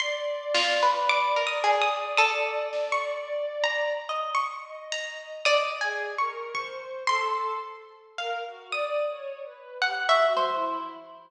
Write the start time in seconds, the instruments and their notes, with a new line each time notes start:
0.00 violin D5, harpsichord C6, closed hi-hat
0.55 orchestral harp F4, snare
0.82 orchestral harp B4
1.09 harpsichord D6
1.36 orchestral harp A#4
1.47 harpsichord D#6
1.64 orchestral harp G#4, clap
1.82 harpsichord D#6
2.17 orchestral harp A4, harpsichord D#6
2.73 snare
2.92 harpsichord C#6
3.64 harpsichord A#5
4.09 orchestral harp D#5
4.35 harpsichord C#6
4.65 violin D#5
4.92 harpsichord A#5
5.45 orchestral harp D5, violin D#5, harpsichord D#6, kick
5.81 violin G#4, orchestral harp G#5
6.18 violin A#4, orchestral harp C#6
6.53 violin C5, orchestral harp C#6, kick
7.07 violin A4, harpsichord C6, orchestral harp C6, kick
8.18 violin A#4, orchestral harp F5
8.47 violin F#4
8.71 violin D5, harpsichord D#6
9.10 violin C#5
9.45 violin B4
9.82 violin G4, orchestral harp F#5
10.09 orchestral harp E5, harpsichord C#6
10.17 violin F#4
10.36 orchestral harp C5, high tom
10.53 violin E4